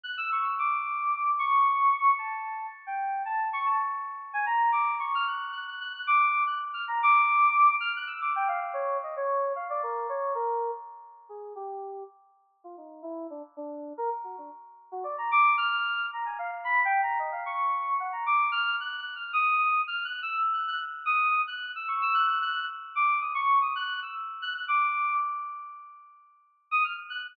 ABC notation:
X:1
M:5/4
L:1/16
Q:1/4=112
K:none
V:1 name="Electric Piano 2"
^f' e' ^c' e' | d'6 ^c'6 a4 z g3 | a2 ^c' a z4 ^g ^a2 d'2 c' f' ^f'2 f' f' f' | ^f' d'3 f' z =f' ^a d'6 f' ^f' e' d' g =f |
z ^c2 ^d c3 f =d ^A2 c2 A3 z4 | ^G2 =G4 z4 F ^D2 E2 =D z D3 | ^A z ^F D z3 F d ^a d'2 =f'4 a ^g f z | (3b2 g2 ^a2 ^d f ^c'4 ^f a =d'2 =f'2 (3^f'2 f'2 =f'2 |
^d'4 (3f'2 ^f'2 e'2 z f' f' z2 d'3 f'2 e' ^c' | e' ^f' f' f'2 z2 d'2 ^d' ^c'2 d' f'2 e' z2 f' f' | d'4 z11 ^d' f' z ^f' f' |]